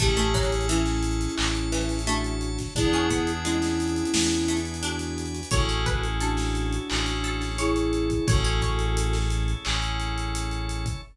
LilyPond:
<<
  \new Staff \with { instrumentName = "Flute" } { \time 4/4 \key a \major \tempo 4 = 87 g'4 <cis' e'>2 <d' fis'>4 | <e' gis'>4 <cis' e'>2 <d' fis'>4 | <fis' a'>4 <d' fis'>2 <e' gis'>4 | <fis' a'>4. r2 r8 | }
  \new Staff \with { instrumentName = "Harpsichord" } { \time 4/4 \key a \major a16 a16 fis8 e4 r8 e8 a4 | d'16 cis'16 b8 gis4 r8 a8 d'4 | cis''16 cis''16 b'8 a'4 r8 a'8 cis''4 | cis''16 cis''16 cis''2~ cis''8 r4 | }
  \new Staff \with { instrumentName = "Electric Piano 2" } { \time 4/4 \key a \major <cis' e' gis' a'>1 | <b d' e' gis'>1 | <cis' e' gis' a'>2 <cis' e' gis' a'>2 | <cis' e' gis' a'>2 <cis' e' gis' a'>2 | }
  \new Staff \with { instrumentName = "Synth Bass 1" } { \clef bass \time 4/4 \key a \major a,,2 a,,2 | e,2 e,2 | a,,2 a,,2 | a,,2 a,,2 | }
  \new Staff \with { instrumentName = "Drawbar Organ" } { \time 4/4 \key a \major <cis'' e'' gis'' a''>2 <cis'' e'' a'' cis'''>2 | <b' d'' e'' gis''>2 <b' d'' gis'' b''>2 | <cis' e' gis' a'>2 <cis' e' a' cis''>2 | <cis' e' gis' a'>2 <cis' e' a' cis''>2 | }
  \new DrumStaff \with { instrumentName = "Drums" } \drummode { \time 4/4 <hh bd>16 hh16 <hh bd>32 hh32 hh32 hh32 hh16 <hh sn>16 hh32 hh32 hh32 hh32 hc16 hh16 hh32 hh32 <hh sn>32 hh32 hh16 hh16 hh16 <hh bd sn>16 | <hh bd>16 hh16 <hh bd>16 hh16 hh16 <hh sn>16 hh32 hh32 hh32 hh32 sn16 hh16 hh32 hh32 hh32 hh32 hh16 <hh sn>16 hh32 hh32 hh32 hh32 | <hh bd>16 hh16 <hh bd>16 hh16 hh16 <hh sn>16 hh16 hh16 hc16 <hh sn>16 hh16 <hh sn>16 hh16 hh16 hh16 <hh bd>16 | <hh bd>16 hh16 <hh bd>16 hh16 hh16 <hh sn>16 hh16 hh16 hc16 hh16 hh16 hh16 hh16 hh16 hh16 <hh bd>16 | }
>>